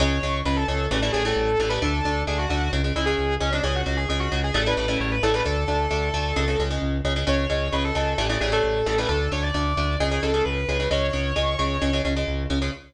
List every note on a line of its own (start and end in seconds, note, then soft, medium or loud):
0.00 0.19 C#2 loud
0.00 0.18 C#3 loud
0.00 0.18 G#3 loud
0.00 0.37 C#5 loud
0.23 0.42 C#2 medium
0.23 0.41 C#3 medium
0.23 0.41 G#3 medium
0.45 0.65 C#2 loud
0.45 0.64 C#3 medium
0.45 0.64 G#3 medium
0.45 0.57 B4 medium
0.56 0.67 A4 medium
0.68 0.88 C#2 loud
0.68 0.86 C#3 medium
0.68 0.86 G#3 medium
0.68 0.86 A4 medium
0.91 1.10 A1 loud
0.91 1.00 C#3 medium
0.91 1.00 E3 loud
0.91 1.00 G3 loud
0.91 1.00 A3 medium
1.02 1.11 C#3 medium
1.02 1.11 E3 medium
1.02 1.11 G3 medium
1.02 1.11 A3 medium
1.12 1.33 A1 medium
1.12 1.23 C#3 medium
1.12 1.23 E3 medium
1.12 1.23 G3 medium
1.12 1.23 A3 medium
1.12 1.23 G#4 medium
1.25 1.52 C#3 medium
1.25 1.52 E3 loud
1.25 1.52 G3 loud
1.25 1.52 A3 medium
1.25 1.59 A4 medium
1.36 1.56 A1 medium
1.59 1.78 A1 loud
1.59 1.69 C#3 medium
1.59 1.69 E3 medium
1.59 1.69 G3 medium
1.59 1.69 A3 medium
1.59 1.71 A4 medium
1.69 1.79 C#3 medium
1.69 1.79 E3 medium
1.69 1.79 G3 medium
1.69 1.79 A3 medium
1.69 1.80 B4 medium
1.82 2.01 D2 loud
1.82 2.00 D3 medium
1.82 2.00 A3 loud
1.82 2.21 A4 loud
2.05 2.24 D2 medium
2.05 2.23 D3 medium
2.05 2.23 A3 medium
2.27 2.47 D2 medium
2.27 2.45 D3 medium
2.27 2.45 A3 medium
2.27 2.39 G#4 medium
2.38 2.49 F#4 medium
2.49 2.69 D2 loud
2.49 2.68 D3 medium
2.49 2.68 A3 medium
2.49 2.71 F#4 loud
2.73 2.92 C#2 loud
2.73 2.82 C#3 medium
2.73 2.82 G#3 medium
2.84 2.93 C#3 medium
2.84 2.93 G#3 medium
2.95 3.15 C#2 medium
2.95 3.05 C#3 medium
2.95 3.05 G#3 medium
2.95 3.07 E4 medium
3.06 3.34 C#3 medium
3.06 3.34 G#3 medium
3.06 3.33 G#4 medium
3.18 3.37 C#2 medium
3.40 3.60 C#2 medium
3.40 3.50 C#3 medium
3.40 3.50 G#3 medium
3.40 3.52 C#4 medium
3.53 3.62 C#3 medium
3.53 3.62 G#3 medium
3.53 3.65 D4 medium
3.63 3.83 C#2 loud
3.63 3.82 C#3 loud
3.63 3.82 G#3 medium
3.63 3.75 G#4 loud
3.75 3.97 F#4 medium
3.86 4.06 C#2 medium
3.86 4.04 C#3 medium
3.86 4.04 G#3 medium
3.97 4.08 G#4 medium
4.09 4.28 C#2 medium
4.09 4.28 C#3 medium
4.09 4.28 G#3 medium
4.09 4.20 G#4 medium
4.20 4.39 F#4 medium
4.32 4.51 C#2 medium
4.32 4.50 C#3 medium
4.32 4.50 G#3 medium
4.44 4.55 G#4 medium
4.54 4.74 A1 loud
4.54 4.63 C#3 loud
4.54 4.63 E3 medium
4.54 4.63 G3 loud
4.54 4.63 A3 loud
4.54 4.66 A4 medium
4.66 4.75 C#3 medium
4.66 4.75 E3 medium
4.66 4.75 G3 medium
4.66 4.75 A3 medium
4.66 4.97 B4 medium
4.77 4.97 A1 medium
4.77 4.86 C#3 medium
4.77 4.86 E3 medium
4.77 4.86 G3 medium
4.77 4.86 A3 medium
4.88 5.15 C#3 medium
4.88 5.15 E3 medium
4.88 5.15 G3 medium
4.88 5.15 A3 medium
5.00 5.19 A1 loud
5.00 5.11 C#5 medium
5.11 5.22 B4 medium
5.23 5.42 A1 loud
5.23 5.32 C#3 loud
5.23 5.32 E3 medium
5.23 5.32 G3 medium
5.23 5.32 A3 medium
5.23 5.34 A4 medium
5.34 5.43 C#3 medium
5.34 5.43 E3 medium
5.34 5.43 G3 medium
5.34 5.43 A3 medium
5.34 5.46 B4 medium
5.45 5.65 D2 loud
5.45 5.64 D3 medium
5.45 5.64 A3 medium
5.45 6.60 A4 loud
5.68 5.87 D2 medium
5.68 5.86 D3 medium
5.68 5.86 A3 medium
5.91 6.10 D2 medium
5.91 6.09 D3 medium
5.91 6.09 A3 loud
6.14 6.33 D2 medium
6.14 6.32 D3 medium
6.14 6.32 A3 medium
6.36 6.56 C#2 loud
6.36 6.45 C#3 loud
6.36 6.45 G#3 loud
6.48 6.57 C#3 medium
6.48 6.57 G#3 medium
6.59 6.78 C#2 loud
6.59 6.69 C#3 medium
6.59 6.69 G#3 medium
6.70 6.98 C#3 medium
6.70 6.98 G#3 medium
6.82 7.01 C#2 medium
7.04 7.24 C#2 medium
7.04 7.14 C#3 medium
7.04 7.14 G#3 medium
7.16 7.25 C#3 medium
7.16 7.25 G#3 medium
7.27 7.47 C#2 loud
7.27 7.45 C#3 loud
7.27 7.45 G#3 medium
7.27 7.73 C#5 loud
7.50 7.69 C#2 loud
7.50 7.68 C#3 medium
7.50 7.68 G#3 medium
7.73 7.92 C#2 medium
7.73 7.91 C#3 medium
7.73 7.91 G#3 medium
7.73 7.84 B4 medium
7.84 7.95 A4 medium
7.95 8.15 C#2 medium
7.95 8.13 C#3 medium
7.95 8.13 G#3 medium
7.95 8.17 A4 medium
8.18 8.37 A1 loud
8.18 8.27 C#3 medium
8.18 8.27 E3 medium
8.18 8.27 G3 loud
8.18 8.27 A3 loud
8.29 8.39 C#3 medium
8.29 8.39 E3 medium
8.29 8.39 G3 medium
8.29 8.39 A3 medium
8.40 8.60 A1 medium
8.40 8.50 C#3 medium
8.40 8.50 E3 medium
8.40 8.50 G3 medium
8.40 8.50 A3 medium
8.40 8.51 G#4 loud
8.52 8.79 C#3 medium
8.52 8.79 E3 medium
8.52 8.79 G3 medium
8.52 8.79 A3 medium
8.52 8.86 A4 medium
8.64 8.83 A1 medium
8.86 9.06 A1 medium
8.86 8.95 C#3 medium
8.86 8.95 E3 medium
8.86 8.95 G3 medium
8.86 8.95 A3 medium
8.86 8.98 A4 loud
8.98 9.07 C#3 medium
8.98 9.07 E3 medium
8.98 9.07 G3 medium
8.98 9.07 A3 medium
8.98 9.09 B4 medium
9.08 9.28 D2 loud
9.08 9.27 D3 medium
9.08 9.27 A3 medium
9.08 9.29 A4 loud
9.32 9.51 D2 loud
9.32 9.50 D3 medium
9.32 9.50 A3 medium
9.32 9.43 C#5 medium
9.43 9.53 D5 medium
9.54 9.74 D2 loud
9.54 9.72 D3 medium
9.54 9.72 A3 medium
9.54 9.97 D5 medium
9.77 9.97 D2 loud
9.77 9.95 D3 medium
9.77 9.95 A3 medium
10.00 10.19 C#2 loud
10.00 10.09 C#3 loud
10.00 10.09 G#3 loud
10.00 10.22 G#4 medium
10.11 10.20 C#3 medium
10.11 10.20 G#3 medium
10.23 10.42 C#2 medium
10.23 10.32 C#3 medium
10.23 10.32 G#3 medium
10.23 10.44 A4 medium
10.34 10.61 C#3 medium
10.34 10.61 G#3 medium
10.45 10.65 C#2 medium
10.45 10.87 B4 medium
10.68 10.87 C#2 medium
10.68 10.78 C#3 medium
10.68 10.78 G#3 loud
10.80 10.89 C#3 medium
10.80 10.89 G#3 medium
10.91 11.10 C#2 loud
10.91 11.09 C#3 loud
10.91 11.09 G#3 loud
10.91 12.00 C#5 loud
11.13 11.33 C#2 loud
11.13 11.31 C#3 medium
11.13 11.31 G#3 medium
11.36 11.56 C#2 medium
11.36 11.54 C#3 medium
11.36 11.54 G#3 loud
11.59 11.78 C#2 medium
11.59 11.77 C#3 medium
11.59 11.77 G#3 medium
11.82 12.01 C#2 loud
11.82 11.91 C#3 medium
11.82 11.91 G#3 loud
11.93 12.02 C#3 medium
11.93 12.02 G#3 medium
12.05 12.24 C#2 loud
12.05 12.14 C#3 medium
12.05 12.14 G#3 medium
12.16 12.44 C#3 medium
12.16 12.44 G#3 medium
12.27 12.47 C#2 medium
12.50 12.69 C#2 medium
12.50 12.59 C#3 medium
12.50 12.59 G#3 medium
12.62 12.71 C#3 medium
12.62 12.71 G#3 medium